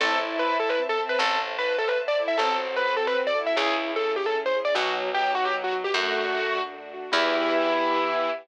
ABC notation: X:1
M:6/8
L:1/16
Q:3/8=101
K:Em
V:1 name="Acoustic Grand Piano"
A2 z2 B2 A B z A z B | A2 z2 B2 A B z d z e | A2 z2 B2 A B z d z e | ^G2 z2 A2 =G A z c z d |
F2 z2 G2 F G z F z G | F8 z4 | E12 |]
V:2 name="Violin"
E10 C2 | z10 E2 | C10 E2 | E4 z8 |
F,4 F,2 F,6 | A,8 z4 | E,12 |]
V:3 name="Acoustic Grand Piano"
C2 A2 E2 A2 C2 A2 | C2 A2 E2 A2 C2 A2 | C2 A2 F2 A2 C2 A2 | ^C2 ^G2 E2 G2 C2 G2 |
B,2 F2 ^D2 F2 B,2 F2 | A,2 F2 D2 F2 A,2 F2 | [B,EG]12 |]
V:4 name="Electric Bass (finger)" clef=bass
A,,,12 | A,,,12 | A,,,12 | ^C,,12 |
B,,,12 | F,,12 | E,,12 |]
V:5 name="String Ensemble 1"
[cea]12 | [cea]12 | [CFA]12 | [^CE^G]12 |
[B,^DF]12 | [A,DF]12 | [B,EG]12 |]